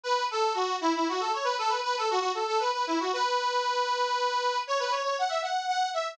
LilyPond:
\new Staff { \time 6/8 \key fis \minor \tempo 4. = 78 b'8 a'8 fis'8 e'16 e'16 fis'16 a'16 cis''16 b'16 | a'16 b'16 b'16 a'16 fis'16 fis'16 a'16 a'16 b'16 b'16 e'16 fis'16 | b'2. | cis''16 b'16 cis''16 cis''16 fis''16 e''16 fis''8 fis''8 e''8 | }